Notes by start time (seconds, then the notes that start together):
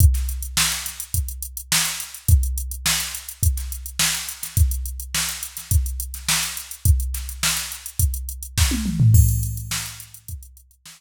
0.00 kick, closed hi-hat
0.14 snare, closed hi-hat
0.29 closed hi-hat
0.43 closed hi-hat
0.57 snare
0.72 closed hi-hat
0.86 snare, closed hi-hat
1.00 closed hi-hat
1.14 kick, closed hi-hat
1.28 closed hi-hat
1.43 closed hi-hat
1.57 closed hi-hat
1.72 snare
1.85 closed hi-hat
2.00 closed hi-hat
2.14 closed hi-hat
2.28 kick, closed hi-hat
2.43 closed hi-hat
2.58 closed hi-hat
2.71 closed hi-hat
2.86 snare
3.00 closed hi-hat
3.15 closed hi-hat
3.29 closed hi-hat
3.43 kick, closed hi-hat
3.57 snare, closed hi-hat
3.72 closed hi-hat
3.86 closed hi-hat
3.99 snare
4.15 closed hi-hat
4.29 closed hi-hat
4.43 snare, closed hi-hat
4.57 kick, closed hi-hat
4.71 closed hi-hat
4.86 closed hi-hat
5.00 closed hi-hat
5.15 snare
5.29 closed hi-hat
5.43 closed hi-hat
5.57 snare, closed hi-hat
5.71 kick, closed hi-hat
5.86 closed hi-hat
6.00 closed hi-hat
6.14 snare, closed hi-hat
6.28 snare
6.43 closed hi-hat
6.57 closed hi-hat
6.71 closed hi-hat
6.85 kick, closed hi-hat
7.00 closed hi-hat
7.14 snare, closed hi-hat
7.29 closed hi-hat
7.43 snare
7.57 snare, closed hi-hat
7.72 closed hi-hat
7.86 closed hi-hat
7.99 kick, closed hi-hat
8.14 closed hi-hat
8.29 closed hi-hat
8.43 closed hi-hat
8.58 kick, snare
8.71 high tom
8.86 mid tom
9.00 floor tom
9.14 kick, crash
9.29 closed hi-hat
9.43 closed hi-hat
9.57 closed hi-hat
9.71 snare
9.86 closed hi-hat
10.00 closed hi-hat
10.14 closed hi-hat
10.28 kick, closed hi-hat
10.43 closed hi-hat
10.57 closed hi-hat
10.71 closed hi-hat
10.86 snare